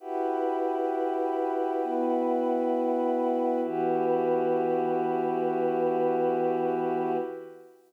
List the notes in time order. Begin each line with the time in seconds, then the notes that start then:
0.00 E4 F#4 G4 B4 F#5 G5
1.83 B3 E4 F#4 B4
3.64 E3 B3 E4 F#4 G4 B4